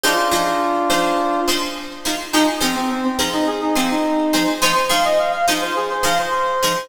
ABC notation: X:1
M:4/4
L:1/16
Q:1/4=105
K:Fdor
V:1 name="Brass Section"
[DF]10 z6 | E z C C C C z E A E C E5 | c z f e f f z c A c f c5 |]
V:2 name="Pizzicato Strings"
[F,EAc]2 [F,EAc]4 [F,EAc]4 [F,EAc]4 [F,EAc]2 | [F,EAc]2 [F,EAc]4 [F,EAc]4 [F,EAc]4 [F,EAc]2 | [F,EAc]2 [F,EAc]4 [F,EAc]4 [F,EAc]4 [F,EAc]2 |]